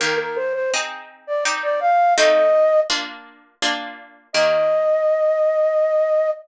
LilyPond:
<<
  \new Staff \with { instrumentName = "Flute" } { \time 3/4 \key ees \major \tempo 4 = 83 bes'16 bes'16 c''16 c''16 r8. d''16 r16 d''16 f''8 | ees''4 r2 | ees''2. | }
  \new Staff \with { instrumentName = "Harpsichord" } { \time 3/4 \key ees \major <ees bes g'>4 <c' ees' aes'>4 <c' ees' g'>4 | <a c' ees' f'>4 <bes d' f'>4 <bes d' f'>4 | <ees bes g'>2. | }
>>